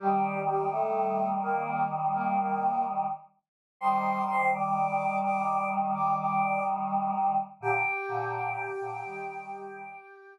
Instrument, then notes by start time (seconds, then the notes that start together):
choir aahs
0.00 D#3 G3 G4
0.47 G3 G4
0.71 A3 A4
1.42 A#3 A#4
2.14 A#3 A#4
2.38 A#3 A#4
3.81 D#3 G3 C5 C6
4.28 C5 C6
4.53 D5 D6
5.24 D5 D6
5.94 D5 D6
6.19 D5 D6
7.61 A#2 D3 G4 G5
8.08 A#2 D3
8.80 A#2 D3
9.04 D#3 G3